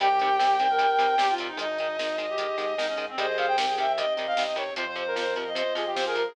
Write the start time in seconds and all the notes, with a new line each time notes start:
0.00 C2 C3 D#3 G3 C4 D#4 G4 G5, kick, closed hi-hat
0.10 G4, kick
0.19 C3 D#3 G3 G4, kick, closed hi-hat
0.30 kick
0.39 C3 D#3 G3 G4, kick, snare
0.49 kick
0.59 C3 D#3 G3, kick, closed hi-hat
0.69 A#4, kick
0.79 C3 D#3 G3, kick, closed hi-hat
0.90 kick
0.98 C3 D#3 G3, kick, snare, closed hi-hat
1.10 kick
1.18 C3 D#3 G3 G4, kick, snare
1.29 F4, kick
1.38 C3 D#3 G3, kick, closed hi-hat
1.48 D#4, kick
1.57 G#1 D#3 G#3 D#4 G#4 D#5, closed hi-hat
1.68 D#4, kick
1.78 D#3 G#3 D#4, kick, closed hi-hat
1.89 kick
1.98 D#3 G#3 D#4, kick, snare
2.09 kick
2.18 D#3 G#3, kick, closed hi-hat
2.29 G4, kick
2.38 D#3 G#3, kick, closed hi-hat
2.49 kick
2.58 G#2 D#3 G#3, kick, snare, closed hi-hat
2.69 kick
2.77 G#2 D#3 G#3 D#4, kick, snare
2.89 C#4, kick
2.97 D#3 G#3, kick, closed hi-hat
3.08 C4, kick
3.17 C2 C3 D#3 G3 C4 D#4 G4 G#4 C5 D#5, kick, closed hi-hat
3.28 D#5, kick
3.38 C3 D#3 G3 F5, kick, closed hi-hat
3.48 G5, kick
3.57 C3 D#3 G3, kick, snare
3.67 G#4, kick
3.77 C3 D#3 G3 E5, kick, closed hi-hat
3.87 kick
3.97 C3 D#3 G3 D#5, kick, closed hi-hat
4.07 kick
4.17 C3 D#3 G3, kick, snare, closed hi-hat
4.27 F5, kick
4.37 C3 D#3 G3, kick, snare
4.47 D#5, kick
4.56 C3 D#3 G3 C#5, kick, closed hi-hat
4.68 kick
4.76 F2 C3 F3 C4 F4 C5, kick, closed hi-hat
4.86 C5, kick
4.96 C3 F3 C5, kick, closed hi-hat
5.07 A#4, kick
5.16 C3 F3 C5, kick, snare
5.26 kick
5.36 C3 F3, kick, closed hi-hat
5.46 D#5, kick
5.55 C3 F3 C5, kick, closed hi-hat
5.65 kick
5.75 C3 F3 G#4, kick, snare, closed hi-hat
5.86 G4, kick
5.95 C3 F3 C5, kick, snare
6.06 G#4 A#4, kick
6.15 C3 F3 A#4, kick, closed hi-hat
6.25 G#4, kick